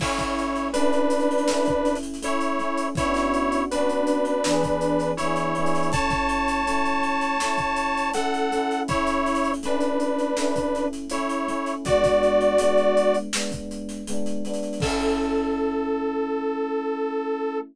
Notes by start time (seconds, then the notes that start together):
0.00 A3 C#4 E4 C#5, kick, crash
0.04 E4
0.18 kick, snare, closed hi-hat
0.38 closed hi-hat
0.56 closed hi-hat
0.73 A3 C#4 D4 B4, closed hi-hat
0.78 E4
0.93 closed hi-hat
1.10 closed hi-hat
1.20 closed hi-hat
1.31 closed hi-hat
1.38 closed hi-hat
1.48 A3 C#4, snare
1.52 E4
1.65 kick, closed hi-hat
1.85 closed hi-hat
1.95 closed hi-hat
2.03 closed hi-hat
2.14 closed hi-hat
2.22 A3 C#4 E4 C#5, closed hi-hat
2.26 E4
2.41 closed hi-hat
2.59 A3 C#4, closed hi-hat
2.63 E4
2.77 closed hi-hat
2.95 B3 C#4 E4 C#5, kick, closed hi-hat
3.01 D4 F#4
3.14 snare, closed hi-hat
3.34 closed hi-hat
3.52 closed hi-hat
3.70 B3 C#4 D4 B4, closed hi-hat
3.75 D4 F#4
3.90 closed hi-hat
4.07 closed hi-hat
4.25 closed hi-hat
4.44 E3 B3, snare
4.48 D4 G#4
4.63 kick, closed hi-hat
4.81 closed hi-hat
4.99 snare, closed hi-hat
5.17 E3 B3 E4 C#5, closed hi-hat
5.23 D4 G#4
5.36 closed hi-hat
5.55 E3 B3, closed hi-hat
5.60 D4 G#4
5.66 closed hi-hat
5.75 closed hi-hat
5.83 closed hi-hat
5.92 A3 C#4 C#5 A5, kick, closed hi-hat
5.97 E4
6.10 kick, snare, closed hi-hat
6.29 closed hi-hat
6.48 closed hi-hat
6.67 A3 C#4, closed hi-hat
6.71 E4
6.85 closed hi-hat
7.03 closed hi-hat
7.21 closed hi-hat
7.40 A3 C#4, snare
7.45 E4
7.58 kick, closed hi-hat
7.76 closed hi-hat
7.97 closed hi-hat
8.14 A3 C#4 A4 F#5, closed hi-hat
8.19 E4
8.34 closed hi-hat
8.52 A3 C#4, closed hi-hat
8.56 E4
8.71 closed hi-hat
8.88 A3 C#4 E4 C#5, kick, closed hi-hat
8.93 E4
9.07 snare, closed hi-hat
9.26 closed hi-hat
9.35 closed hi-hat
9.44 closed hi-hat
9.54 closed hi-hat
9.63 A3 C#4 D4 B4, closed hi-hat
9.67 E4
9.80 snare, closed hi-hat
10.00 closed hi-hat
10.19 closed hi-hat
10.37 A3 C#4, snare
10.41 E4
10.56 kick, closed hi-hat
10.75 closed hi-hat
10.93 closed hi-hat
11.10 A3 C#4 E4 C#5, closed hi-hat
11.15 E4
11.29 snare, closed hi-hat
11.48 A3 C#4, closed hi-hat
11.52 E4
11.66 closed hi-hat
11.85 G#3 B3 F#4 D5, kick, closed hi-hat
11.90 D4
12.04 kick, snare, closed hi-hat
12.23 closed hi-hat
12.41 closed hi-hat
12.58 G#3 B3, closed hi-hat
12.63 D4
12.77 closed hi-hat
12.97 closed hi-hat
13.14 closed hi-hat
13.33 G#3 B3, snare
13.38 D4
13.52 kick, closed hi-hat
13.71 closed hi-hat
13.89 snare, closed hi-hat
14.07 G#3 B3, closed hi-hat
14.12 D4
14.26 closed hi-hat
14.45 G#3 B3, closed hi-hat
14.49 D4
14.54 closed hi-hat
14.63 closed hi-hat
14.73 closed hi-hat
14.80 A3 C#4 A4, kick, crash
14.86 E4